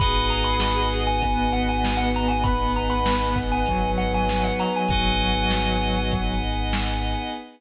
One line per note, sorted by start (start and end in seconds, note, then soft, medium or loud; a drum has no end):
0.00 4.50 G#1 medium
0.00 2.43 B3 medium
0.00 2.43 D#4 medium
0.00 2.43 F#4 medium
0.00 1.00 G#4 medium
0.00 2.43 G#4 medium
0.00 4.80 B4 medium
0.00 4.80 D#5 medium
0.00 4.80 F#5 medium
0.00 4.80 G#5 medium
0.00 0.25 B5 loud
0.00 kick loud
0.00 closed hi-hat loud
0.30 0.45 A#5 loud
0.30 closed hi-hat medium
0.44 0.59 B5 loud
0.60 0.87 B5 loud
0.60 snare loud
0.92 snare medium
0.92 closed hi-hat medium
1.07 1.51 G#5 loud
1.22 2.40 B3 medium
1.22 kick medium
1.22 closed hi-hat loud
1.53 1.67 F#5 loud
1.53 closed hi-hat medium
1.69 1.96 G#5 loud
1.85 snare loud
1.97 2.12 F#5 loud
2.15 2.30 A#5 loud
2.15 closed hi-hat medium
2.28 2.43 G#5 medium
2.44 3.61 B3 medium
2.44 4.88 B3 medium
2.44 4.88 D#4 medium
2.44 4.88 G#4 medium
2.44 4.88 B4 medium
2.44 2.70 B5 loud
2.44 kick loud
2.44 closed hi-hat loud
2.75 2.91 A#5 medium
2.75 closed hi-hat medium
2.90 3.04 B5 medium
3.06 3.32 B5 medium
3.06 snare loud
3.36 kick loud
3.36 snare medium
3.36 closed hi-hat medium
3.52 3.91 G#5 loud
3.66 4.82 F#3 medium
3.66 kick medium
3.66 closed hi-hat loud
3.98 4.12 F#5 medium
3.98 closed hi-hat medium
4.14 4.44 G#5 loud
4.29 snare loud
4.44 4.58 F#5 loud
4.59 4.74 A#5 medium
4.59 snare soft
4.59 open hi-hat medium
4.76 4.88 G#5 loud
4.88 7.14 G#1 medium
4.88 6.27 F#3 medium
4.88 6.11 B3 medium
4.88 6.11 D#4 medium
4.88 6.11 F#4 medium
4.88 6.11 G#4 medium
4.88 7.30 B4 medium
4.88 7.30 D#5 medium
4.88 7.30 F#5 medium
4.88 6.00 G#5 loud
4.88 7.30 G#5 loud
4.88 kick loud
4.88 closed hi-hat loud
5.21 closed hi-hat medium
5.51 snare loud
5.81 snare medium
5.81 closed hi-hat medium
6.11 7.34 B3 medium
6.11 7.34 D#4 medium
6.11 7.34 G#4 medium
6.11 7.34 B4 medium
6.11 kick loud
6.11 closed hi-hat loud
6.43 closed hi-hat medium
6.73 snare loud
7.04 closed hi-hat medium